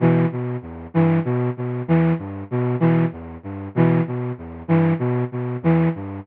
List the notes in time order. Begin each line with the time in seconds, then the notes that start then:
0.00 B2 E3
0.32 B2
0.62 E2
0.94 G2 E3
1.25 B2
1.57 B2
1.87 E2 E3
2.19 G2
2.51 B2
2.80 B2 E3
3.12 E2
3.43 G2
3.75 B2 E3
4.07 B2
4.38 E2
4.68 G2 E3
4.99 B2
5.32 B2
5.62 E2 E3
5.95 G2